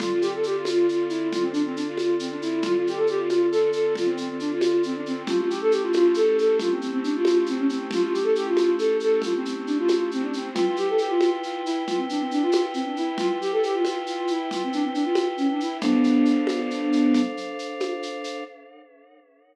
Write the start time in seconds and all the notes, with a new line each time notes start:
0.00 D3 C4 F4 A4, low conga, shaker
0.12 F4
0.21 G4, shaker
0.34 A4
0.43 G4, shaker
0.57 F4
0.65 F4, high conga, shaker
0.89 F4, shaker
1.09 E4, shaker
1.32 F4, low conga, shaker
1.41 C4
1.52 D4, shaker
1.65 C4
1.75 D4, shaker
1.87 F4
1.98 high conga, shaker
2.19 C4, shaker
2.31 D4
2.41 E4, shaker
2.62 F4, low conga, shaker
2.76 F4
2.87 G4, shaker
2.96 A4
3.07 G4, shaker
3.18 F4
3.28 F4, high conga, shaker
3.51 A4, shaker
3.72 A4, shaker
3.95 F4, low conga, shaker
4.06 C4
4.17 C4, shaker
4.29 C4
4.40 D4, shaker
4.52 F4
4.61 high conga, shaker
4.83 C4, shaker
4.96 D4
5.06 C4, shaker
5.27 A3 C#4 E4 F4 G4, low conga, shaker
5.38 F4
5.49 G4, shaker
5.61 A4
5.71 G4, shaker
5.82 F4
5.93 F4, high conga, shaker
6.14 A4, shaker
6.37 A4, shaker
6.59 F4, low conga, shaker
6.70 C4
6.81 C4, shaker
6.92 C4
7.03 D4, shaker
7.15 F4
7.25 high conga, shaker
7.46 C4, shaker
7.57 C#4
7.68 C4, shaker
7.91 F4, low conga, shaker
8.02 F4
8.13 G4, shaker
8.23 A4
8.35 G4, shaker
8.46 F4
8.57 F4, high conga, shaker
8.78 A4, shaker
9.00 A4, shaker
9.22 F4, low conga, shaker
9.36 C4
9.45 C4, shaker
9.55 C4
9.66 D4, shaker
9.78 F4
9.88 high conga, shaker
10.11 C4, shaker
10.22 D4
10.33 C4, shaker
10.54 E4 F4 B4 G5, low conga, shaker
10.67 F4
10.76 G4, shaker
10.89 A4
10.98 G4, shaker
11.09 F4
11.20 F4, high conga, shaker
11.43 F4, shaker
11.65 E4, shaker
11.87 F4, low conga, shaker
11.97 C4
12.09 D4, shaker
12.20 C4
12.31 D4, shaker
12.42 F4
12.52 high conga, shaker
12.74 C4, shaker
12.85 D4
12.97 E4, shaker
13.18 F4, low conga, shaker
13.29 F4
13.41 G4, shaker
13.52 A4
13.63 G4, shaker
13.74 F4
13.85 F4, high conga, shaker
14.06 F4, shaker
14.27 E4, shaker
14.51 F4, low conga, shaker
14.63 C4
14.73 D4, shaker
14.84 C4
14.93 D4, shaker
15.04 F4
15.15 high conga, shaker
15.37 C#4, shaker
15.49 D4
15.60 E4, shaker
15.81 B3 D4 A4 C5 F5, low conga, shaker
16.04 shaker
16.25 shaker
16.47 high conga, shaker
16.71 shaker
16.92 shaker
17.14 low conga, shaker
17.37 shaker
17.59 shaker
17.80 high conga, shaker
18.03 shaker
18.24 shaker